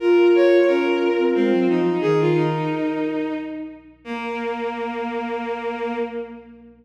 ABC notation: X:1
M:3/4
L:1/16
Q:1/4=89
K:Bbm
V:1 name="Flute"
F12 | B6 z6 | B12 |]
V:2 name="Violin"
B2 d2 B4 C2 E2 | A F E6 z4 | B,12 |]
V:3 name="Flute"
F4 D3 C A, G, F,2 | E,4 z8 | B,12 |]